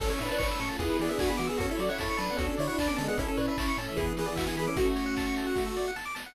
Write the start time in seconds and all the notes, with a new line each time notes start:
0.00 A1 C#4 E4 A4 C#5, kick, crash
0.10 C#4 A4 C#5
0.19 A2 D4 B4 E5, open hi-hat
0.29 D4 B4 A5
0.38 A1 A3 C#4 D4 A4 B4 C#5 C#6, kick, clap
0.49 C#5 E6
0.60 A2 C#4 A4 C#6, open hi-hat
0.69 F4 A5
0.79 E2 B3 D4 E4 G#4, kick, closed hi-hat
0.89 B4
0.99 E3 B3 G#4 D5, open hi-hat
1.09 B3 D4 G#4 E5
1.19 E2 A3 B3 D4 F#4 G#4 B4 G#5, kick, clap
1.28 B3 G#4 B5
1.37 E3 A3 B3 F#4 D6, open hi-hat
1.47 B3 G#4 E6
1.58 F#2 C#4 F#4 A4, kick, closed hi-hat
1.69 E4 A4 C#5
1.77 F#3 F#4 C#5 D5, open hi-hat
1.89 E4 C#5 F#5
1.98 F#2 C#4 E4 A4 C#5 A5, kick, snare
2.09 A4 C#6
2.17 F#3 D4 B4 A5, open hi-hat
2.29 B3 F#5
2.37 D2 C#4 D4 F#4 A4, kick, closed hi-hat
2.50 A4
2.57 D3 E4 C#5 D5, open hi-hat
2.67 D4 E4 C#5 F#5
2.78 D2 D4 A4 B4 D5 A5, kick, clap
2.88 B3 C#4 A4 D6
2.97 D3 G#3 C#4 A4 A5, open hi-hat
3.08 B3 G#4 F#5
3.17 A1 C#4 E4 A4, kick, closed hi-hat
3.28 C#4 A4
3.37 A2 D4 B4 C#5, open hi-hat
3.48 D4 B4 E5
3.57 A1 A3 C#4 E4 A4 C#5 A5, kick, clap
3.68 C#4 C#6
3.77 A2 C#4 A4 A5, open hi-hat
3.88 E3 E5
3.96 E2 E3 B3 D4 E4 G#4, kick, closed hi-hat
4.07 G#4
4.17 E3 B3 G#4 B4, open hi-hat
4.26 E3 B3 G#4 D5
4.36 E2 A3 B3 D4 F#4 G#4 B4 E5, kick, clap
4.47 E3 B3 G#4 G#5
4.57 E3 B3 G#4 B5, open hi-hat
4.67 C#4 A4 D6
4.76 A3 C#4 F#4, kick, closed hi-hat
4.86 A4
4.96 C#5, open hi-hat
5.06 F#5
5.16 A5, kick, clap
5.26 C#6
5.36 A5, open hi-hat
5.47 F#5
5.55 F#4, kick, snare
5.66 A4
5.77 D5, snare
5.88 F#5
5.96 A5, snare
6.05 D6
6.15 A5, snare
6.26 F#5